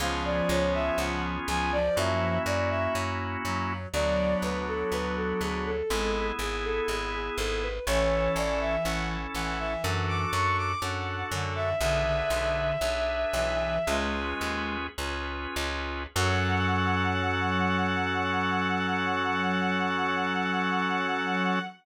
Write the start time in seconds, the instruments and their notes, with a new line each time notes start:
0.00 electric bass (finger) C#2, clarinet F3, drawbar organ B3 C#4 F4 G#4, violin F5
0.25 violin D5
0.49 electric bass (finger) C#2, violin C#5
0.74 violin E5
0.98 electric bass (finger) C#2, violin F#5
1.48 electric bass (finger) C#2, clarinet F3, violin G#5
1.72 clarinet F3, violin D5
1.96 electric bass (finger) F#2, drawbar organ A#3 C#4 E4 F#4, violin E5
2.46 electric bass (finger) F#2, violin D5
2.70 violin E5
2.95 electric bass (finger) F#2
3.44 electric bass (finger) F#2, clarinet F#3
3.93 electric bass (finger) D2, clarinet F#3, drawbar organ B3 D4 F#4, violin D5
4.42 electric bass (finger) D2, violin B4
4.67 violin A4
4.92 electric bass (finger) D2, violin B4
5.16 violin A4
5.41 electric bass (finger) D2, violin G#4
5.66 violin A4
5.90 electric bass (finger) G#1, clarinet G#3, drawbar organ B3 E4 G#4
6.39 electric bass (finger) G#1, violin G#4
6.64 violin A4
6.88 electric bass (finger) G#1, violin G#4
7.14 violin G#4
7.38 electric bass (finger) G#1, violin A4
7.62 violin B4
7.87 electric bass (finger) A1, clarinet E3, drawbar organ C#4 E4 A4, violin C#5
8.36 electric bass (finger) A1, violin D5
8.61 violin E5
8.85 electric bass (finger) A1, drawbar organ C#4 E4 A4, violin F#5
9.34 electric bass (finger) A1, clarinet E3, violin F#5
9.59 clarinet E3, violin E5
9.84 electric bass (finger) F#2, drawbar organ D4 F#4 A4, violin F#5
10.08 violin D6
10.33 electric bass (finger) F#2, violin C#6
10.58 violin D6
10.82 electric bass (finger) F#2, drawbar organ D4 F#4 A4, violin F#5
11.31 electric bass (finger) F#2, clarinet D3
11.56 violin E5
11.80 electric bass (finger) B1, clarinet D3, drawbar organ D4 G#4 B4, violin E5
12.05 clarinet D3
12.30 electric bass (finger) B1
12.81 electric bass (finger) B1, drawbar organ D4 G#4 B4
13.33 electric bass (finger) B1, clarinet E3
13.87 electric bass (finger) C#2, clarinet G#3, drawbar organ C#4 F4 G#4 B4
14.41 electric bass (finger) D#2
14.98 electric bass (finger) C#2, drawbar organ C#4 F4 G#4 B4
15.56 electric bass (finger) C#2
16.16 electric bass (finger) F#2, clarinet F#3, drawbar organ C#4 F#4 A4, violin F#5